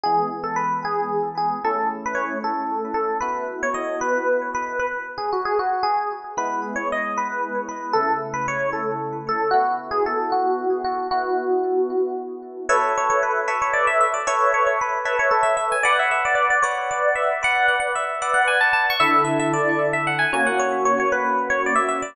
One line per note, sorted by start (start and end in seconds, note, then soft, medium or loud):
0.04 1.60 E3 medium
0.04 1.60 G#3 medium
0.04 1.60 B3 medium
0.04 0.29 G#4 medium
0.44 0.56 A4 medium
0.56 0.80 B4 medium
0.85 1.29 G#4 medium
1.38 1.59 G#4 medium
1.64 3.19 A3 medium
1.64 3.19 C#4 medium
1.64 3.19 E4 medium
1.64 1.88 A4 medium
2.06 2.18 B4 medium
2.15 2.38 C#5 medium
2.44 2.94 A4 medium
2.94 3.17 A4 medium
3.21 4.77 B3 medium
3.21 4.77 E4 medium
3.21 4.77 F#4 medium
3.21 3.44 B4 medium
3.63 3.75 C#5 medium
3.74 4.00 D#5 medium
4.01 4.50 B4 medium
4.55 4.79 B4 medium
4.79 4.92 B4 medium
5.18 5.30 G#4 medium
5.33 5.45 F#4 medium
5.45 5.58 G#4 medium
5.59 5.84 F#4 medium
5.83 6.09 G#4 medium
6.37 7.92 G#3 medium
6.37 7.92 B3 medium
6.37 7.92 E4 medium
6.37 6.60 B4 medium
6.76 6.88 C#5 medium
6.92 7.17 D#5 medium
7.18 7.61 B4 medium
7.69 7.94 B4 medium
7.93 9.50 C#3 medium
7.93 9.50 A3 medium
7.93 9.50 E4 medium
7.93 8.18 A4 medium
8.34 8.46 B4 medium
8.48 8.70 C#5 medium
8.73 9.17 A4 medium
9.29 9.50 A4 medium
9.51 11.08 B3 medium
9.51 11.08 E4 medium
9.51 9.76 F#4 medium
9.51 11.08 F#4 medium
9.91 10.04 G#4 medium
10.06 10.31 A4 medium
10.32 10.82 F#4 medium
10.84 11.07 F#4 medium
11.11 12.66 B3 medium
11.11 12.66 E4 medium
11.11 12.22 F#4 medium
11.11 12.66 F#4 medium
12.69 13.40 A4 loud
12.69 13.40 B4 loud
12.69 12.92 C#5 medium
12.69 13.40 E5 loud
12.98 13.09 C#5 medium
13.10 13.22 C#5 medium
13.23 13.56 B4 medium
13.48 14.19 A4 medium
13.48 14.19 B4 loud
13.48 14.19 C#5 loud
13.48 14.19 E5 loud
13.62 13.74 C#5 medium
13.73 13.86 D5 medium
13.87 14.00 E5 medium
14.01 14.13 E5 medium
14.14 14.26 D5 medium
14.27 14.98 A4 medium
14.27 14.98 B4 loud
14.27 14.52 C#5 loud
14.27 14.98 E5 loud
14.54 14.66 C#5 medium
14.67 14.79 C#5 medium
14.81 15.17 B4 medium
15.05 15.76 A4 medium
15.05 15.76 B4 loud
15.05 15.76 C#5 medium
15.05 15.76 E5 loud
15.19 15.32 C#5 medium
15.31 15.44 A4 medium
15.43 15.55 E5 medium
15.57 15.69 E5 medium
15.72 15.84 G#5 medium
15.83 16.56 B4 loud
15.83 15.96 D5 medium
15.83 16.56 F#5 loud
15.99 16.11 E5 medium
16.11 16.24 E5 medium
16.25 16.35 D5 medium
16.35 16.48 D5 medium
16.50 16.63 D5 medium
16.62 17.34 B4 medium
16.62 16.88 C#5 medium
16.62 17.34 D5 loud
16.62 17.34 F#5 medium
16.91 17.14 D5 medium
17.15 17.40 E5 medium
17.43 18.14 B4 medium
17.43 18.14 D5 loud
17.43 17.67 F#5 loud
17.68 17.79 F#5 medium
17.80 17.92 F#5 medium
17.96 18.33 E5 medium
18.22 18.93 B4 loud
18.22 18.93 D5 loud
18.22 18.93 F#5 loud
18.34 18.46 F#5 medium
18.48 18.60 G#5 medium
18.61 18.73 A5 medium
18.73 18.86 A5 medium
18.90 19.02 C#6 medium
19.00 20.25 D3 loud
19.00 20.25 E4 loud
19.00 20.25 A4 loud
19.00 19.23 E5 medium
19.25 19.37 E5 medium
19.39 19.52 E5 medium
19.54 19.87 D5 medium
19.93 20.06 E5 medium
20.07 20.20 F#5 medium
20.19 20.31 G#5 medium
20.33 22.01 A#3 loud
20.33 22.01 C#4 loud
20.33 22.01 F#4 loud
20.33 20.46 G#5 medium
20.46 20.59 F#5 medium
20.60 20.84 C#5 medium
20.85 20.98 C#5 medium
21.00 21.12 C#5 medium
21.12 21.49 B4 medium
21.50 21.62 C#5 medium
21.66 21.79 D5 medium
21.76 21.88 E5 medium
21.89 22.01 E5 medium
22.02 22.15 D5 medium